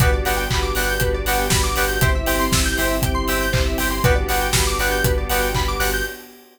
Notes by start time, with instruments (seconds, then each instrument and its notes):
0.00 synth bass 2 G1, string ensemble 1 B3 D4 F#4 G4, electric piano 2 B3 D4 F#4 G4, lead 1 (square) B4, kick, closed hi-hat
0.12 lead 1 (square) D5
0.25 synth bass 2 G1, electric piano 2 B3 D4 F#4 G4, lead 1 (square) F#5, open hi-hat
0.37 lead 1 (square) G5
0.50 synth bass 2 G1, lead 1 (square) B5, kick, clap
0.62 lead 1 (square) D6
0.75 synth bass 2 G1, electric piano 2 B3 D4 F#4 G4, lead 1 (square) F#6, open hi-hat
0.89 lead 1 (square) G6
1.00 synth bass 2 G1, lead 1 (square) B4, kick, closed hi-hat
1.14 lead 1 (square) D5
1.26 synth bass 2 G1, electric piano 2 B3 D4 F#4 G4, lead 1 (square) F#5, open hi-hat
1.39 lead 1 (square) G5
1.50 synth bass 2 G1, lead 1 (square) B5, kick, snare
1.64 lead 1 (square) D6
1.76 synth bass 2 G1, electric piano 2 B3 D4 F#4 G4, lead 1 (square) F#6, open hi-hat
1.88 lead 1 (square) G6
2.01 synth bass 2 G1, electric piano 2 C4 E4 G4, string ensemble 1 C4 E4 G4, lead 1 (square) C5, kick, closed hi-hat
2.15 lead 1 (square) E5
2.26 synth bass 2 G1, electric piano 2 C4 E4 G4, lead 1 (square) G5, open hi-hat
2.39 lead 1 (square) C6
2.52 synth bass 2 G1, lead 1 (square) E6, kick, snare
2.65 lead 1 (square) G6
2.77 synth bass 2 G1, electric piano 2 C4 E4 G4, lead 1 (square) C5, open hi-hat
2.89 lead 1 (square) E5
3.02 synth bass 2 G1, lead 1 (square) G5, kick, closed hi-hat
3.14 lead 1 (square) C6
3.28 synth bass 2 G1, electric piano 2 C4 E4 G4, lead 1 (square) E6, open hi-hat
3.41 lead 1 (square) G6
3.53 synth bass 2 G1, lead 1 (square) C5, kick, clap
3.66 lead 1 (square) E5
3.78 synth bass 2 G1, electric piano 2 C4 E4 G4, lead 1 (square) G5, open hi-hat
3.91 lead 1 (square) C6
4.03 synth bass 2 G1, string ensemble 1 B3 D4 F#4 G4, electric piano 2 B3 D4 F#4 G4, lead 1 (square) B4, kick, closed hi-hat
4.15 lead 1 (square) D5
4.28 synth bass 2 G1, electric piano 2 B3 D4 F#4 G4, lead 1 (square) F#5, open hi-hat
4.41 lead 1 (square) G5
4.53 synth bass 2 G1, lead 1 (square) B5, kick, snare
4.67 lead 1 (square) D6
4.79 synth bass 2 G1, electric piano 2 B3 D4 F#4 G4, lead 1 (square) F#6, open hi-hat
4.91 lead 1 (square) G6
5.04 synth bass 2 G1, lead 1 (square) B4, kick, closed hi-hat
5.18 lead 1 (square) D5
5.30 synth bass 2 G1, electric piano 2 B3 D4 F#4 G4, lead 1 (square) F#5, open hi-hat
5.42 lead 1 (square) G5
5.55 synth bass 2 G1, lead 1 (square) B5, kick, clap
5.68 lead 1 (square) D6
5.80 synth bass 2 G1, electric piano 2 B3 D4 F#4 G4, lead 1 (square) F#6, open hi-hat
5.93 lead 1 (square) G6